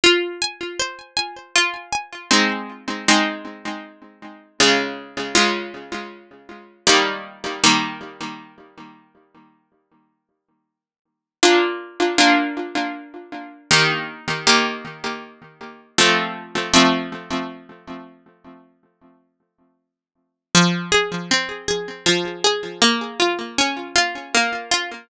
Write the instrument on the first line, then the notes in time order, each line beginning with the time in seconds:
harpsichord
0.04 F4
0.42 G#5
0.79 C5
1.17 G#5
1.56 F4
1.92 G#5
2.31 G#3 C4 D#4
3.08 G#3 C4 D#4
4.60 C#3 G#3 F4
5.35 C#3 G#3 F4
6.87 D#3 G3 A#3
7.64 D#3 G3 A#3
11.43 A#3 D4 F4
12.18 A#3 D4 F4
13.71 D#3 A#3 G4
14.47 D#3 A#3 G4
15.98 F3 A3 C4
16.74 F3 A3 C4
20.55 F3
20.92 G#4
21.31 C4
21.68 G#4
22.06 F3
22.44 G#4
22.82 A#3
23.20 F4
23.58 C#4
23.96 F4
24.34 A#3
24.71 F4